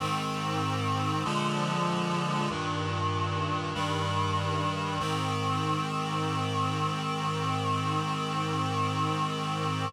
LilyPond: \new Staff { \time 4/4 \key aes \major \tempo 4 = 48 <aes, ees c'>4 <bes, d f aes>4 <g, bes, ees>4 <g, ees g>4 | <aes, ees c'>1 | }